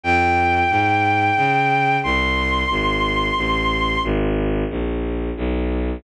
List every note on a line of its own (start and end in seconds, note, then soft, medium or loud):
0.04 0.64 F2 medium
0.04 1.97 G5 medium
0.70 1.30 G#2 medium
1.37 1.97 C#3 medium
2.03 2.64 C2 medium
2.03 4.01 C6 medium
2.70 3.30 G#1 medium
3.37 3.97 A1 medium
4.04 4.64 G#1 loud
4.70 5.30 A#1 medium
5.37 5.97 B1 medium